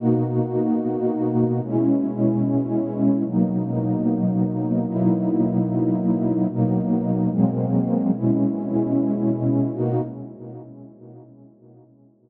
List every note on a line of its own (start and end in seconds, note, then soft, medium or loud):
0.00 1.61 B2 loud
0.00 1.61 A#3 loud
0.00 1.61 D#4 loud
0.00 1.61 F#4 loud
1.62 3.23 B2 loud
1.62 3.23 G#3 loud
1.62 3.23 C#4 loud
1.62 3.23 E4 medium
3.24 4.85 B2 loud
3.24 4.85 F#3 medium
3.24 4.85 A#3 medium
3.24 4.85 D#4 loud
4.87 6.47 B2 loud
4.87 6.47 F#3 medium
4.87 6.47 A#3 loud
4.87 6.47 D#4 loud
4.87 6.47 E4 loud
6.49 7.29 B2 loud
6.49 7.29 F#3 medium
6.49 7.29 A#3 loud
6.49 7.29 D#4 loud
7.30 8.10 B2 loud
7.30 8.11 F#3 loud
7.30 8.10 G#3 loud
7.30 8.11 A#3 loud
7.30 8.11 C4 loud
8.11 9.71 B2 loud
8.11 9.71 G#3 medium
8.11 9.71 C#4 loud
8.11 9.71 E4 medium
9.73 10.01 B2 loud
9.73 10.01 A#3 loud
9.73 10.01 D#4 loud
9.73 10.01 F#4 loud